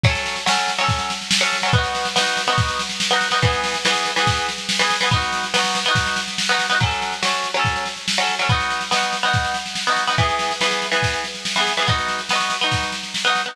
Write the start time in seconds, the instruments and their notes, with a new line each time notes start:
0.03 pizzicato strings F#3 C#4, kick, snare
0.10 pizzicato strings A4
0.15 snare
0.26 snare
0.36 snare
0.46 pizzicato strings F#3 C#4, snare
0.51 pizzicato strings A4
0.58 snare
0.68 snare
0.78 pizzicato strings F#3 C#4, snare
0.84 pizzicato strings A4
0.88 kick, snare
0.99 snare
1.10 snare
1.21 snare
1.31 snare
1.41 pizzicato strings F#3 C#4, snare
1.46 pizzicato strings A4
1.53 snare
1.62 pizzicato strings F#3 C#4, snare
1.68 pizzicato strings A4
1.73 pizzicato strings B3 D#4, kick, snare
1.78 pizzicato strings F#4
1.83 snare
1.95 snare
2.05 snare
2.16 pizzicato strings B3 D#4, snare
2.21 pizzicato strings F#4
2.26 snare
2.37 snare
2.47 pizzicato strings B3 D#4, snare
2.53 pizzicato strings F#4
2.58 kick, snare
2.68 snare
2.79 snare
2.89 snare
3.00 snare
3.10 pizzicato strings B3 D#4, snare
3.16 pizzicato strings F#4
3.21 snare
3.31 pizzicato strings B3 D#4, snare
3.37 pizzicato strings F#4
3.42 pizzicato strings E3 B3, kick, snare
3.47 pizzicato strings G#4
3.53 snare
3.64 snare
3.74 snare
3.85 pizzicato strings E3 B3, snare
3.90 pizzicato strings G#4
3.95 snare
4.05 snare
4.16 pizzicato strings E3 B3, snare
4.21 pizzicato strings G#4
4.27 kick, snare
4.37 snare
4.49 snare
4.58 snare
4.69 snare
4.79 pizzicato strings E3 B3, snare
4.84 pizzicato strings G#4
4.90 snare
5.01 pizzicato strings E3 B3, snare
5.06 pizzicato strings G#4
5.11 pizzicato strings B3 D#4, kick, snare
5.16 pizzicato strings F#4
5.21 snare
5.32 snare
5.43 snare
5.54 pizzicato strings B3 D#4, snare
5.59 pizzicato strings F#4
5.64 snare
5.75 snare
5.85 pizzicato strings B3 D#4, snare
5.91 pizzicato strings F#4
5.95 kick, snare
6.06 snare
6.16 snare
6.28 snare
6.38 snare
6.49 pizzicato strings B3 D#4, snare
6.54 pizzicato strings F#4
6.59 snare
6.69 pizzicato strings B3 D#4, snare
6.75 pizzicato strings F#4
6.80 pizzicato strings F#3 C#4, kick, snare
6.85 pizzicato strings A4
6.91 snare
7.02 snare
7.12 snare
7.23 pizzicato strings F#3 C#4, snare
7.28 pizzicato strings A4
7.33 snare
7.44 snare
7.54 pizzicato strings F#3 C#4, snare
7.59 pizzicato strings A4
7.65 kick, snare
7.76 snare
7.85 snare
7.97 snare
8.08 snare
8.18 pizzicato strings F#3 C#4, snare
8.23 pizzicato strings A4
8.29 snare
8.39 pizzicato strings F#3 C#4, snare
8.44 pizzicato strings A4
8.49 pizzicato strings B3 D#4, kick, snare
8.54 pizzicato strings F#4
8.60 snare
8.70 snare
8.81 snare
8.91 pizzicato strings B3 D#4, snare
8.96 pizzicato strings F#4
9.02 snare
9.13 snare
9.23 pizzicato strings B3 D#4, snare
9.28 pizzicato strings F#4
9.33 kick, snare
9.44 snare
9.54 snare
9.66 snare
9.75 snare
9.87 pizzicato strings B3 D#4, snare
9.92 pizzicato strings F#4
9.96 snare
10.07 pizzicato strings B3 D#4, snare
10.12 pizzicato strings F#4
10.18 pizzicato strings E3 B3, kick, snare
10.23 pizzicato strings G#4
10.29 snare
10.39 snare
10.51 snare
10.61 pizzicato strings E3 B3, snare
10.66 pizzicato strings G#4
10.71 snare
10.82 snare
10.92 pizzicato strings E3 B3, snare
10.97 pizzicato strings G#4
11.03 kick, snare
11.13 snare
11.24 snare
11.35 snare
11.45 snare
11.56 pizzicato strings E3 B3, snare
11.61 pizzicato strings G#4
11.67 snare
11.77 pizzicato strings E3 B3, snare
11.82 pizzicato strings G#4
11.87 pizzicato strings B3 D#4, kick, snare
11.92 pizzicato strings F#4
11.98 snare
12.08 snare
12.19 snare
12.29 pizzicato strings B3 D#4, snare
12.35 pizzicato strings F#4
12.40 snare
12.50 snare
12.61 pizzicato strings B3 D#4, snare
12.66 pizzicato strings F#4
12.71 kick, snare
12.83 snare
12.92 snare
13.03 snare
13.14 snare
13.24 pizzicato strings B3 D#4, snare
13.30 pizzicato strings F#4
13.35 snare
13.46 pizzicato strings B3 D#4, snare
13.51 pizzicato strings F#4